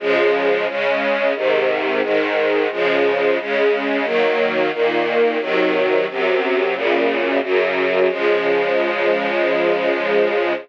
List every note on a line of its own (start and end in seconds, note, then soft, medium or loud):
0.00 0.66 C#3 loud
0.00 0.66 F3 loud
0.00 0.66 G#3 loud
0.66 1.33 C#3 medium
0.66 1.33 G#3 medium
0.66 1.33 C#4 medium
1.35 2.01 G#2 loud
1.35 2.02 C3 medium
1.35 2.01 D#3 medium
2.02 2.68 G#2 medium
2.02 2.68 D#3 loud
2.02 2.68 G#3 medium
2.71 3.37 C#3 loud
2.71 3.37 F3 loud
2.71 3.37 G#3 medium
3.38 4.05 C#3 loud
3.38 4.05 G#3 medium
3.38 4.05 C#4 medium
4.04 4.70 D#3 loud
4.04 4.70 F#3 loud
4.04 4.70 A#3 medium
4.72 5.39 A#2 medium
4.72 5.38 D#3 medium
4.72 5.39 A#3 medium
5.39 6.06 C3 medium
5.39 6.06 D#3 loud
5.39 6.06 F#3 loud
6.08 6.72 F#2 medium
6.08 6.75 C3 medium
6.08 6.75 F#3 medium
6.73 7.40 F#2 medium
6.73 7.40 A#2 medium
6.73 7.40 C#3 medium
7.42 8.09 F#2 loud
7.42 8.08 C#3 medium
7.42 8.09 F#3 medium
8.09 10.53 C#3 medium
8.09 10.53 F3 loud
8.09 10.53 G#3 loud